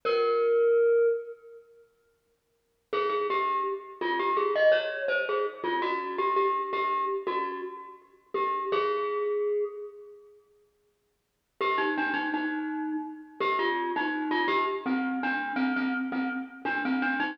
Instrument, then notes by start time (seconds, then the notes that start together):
glockenspiel
0.05 A#4
2.93 G#4
3.09 G#4
3.30 G4
4.01 F4
4.19 G4
4.37 G#4
4.55 D#5
4.72 C#5
5.08 C5
5.29 G#4
5.64 F4
5.82 F#4
6.18 G4
6.36 G4
6.73 G4
7.27 F#4
8.34 G4
8.72 G#4
11.61 G4
11.78 D#4
11.98 D4
12.14 D#4
12.34 D#4
13.40 G4
13.59 F4
13.96 D#4
14.31 F4
14.48 G4
14.86 C4
15.23 D4
15.56 C4
15.76 C4
16.12 C4
16.65 D4
16.85 C4
17.02 D4
17.20 D#4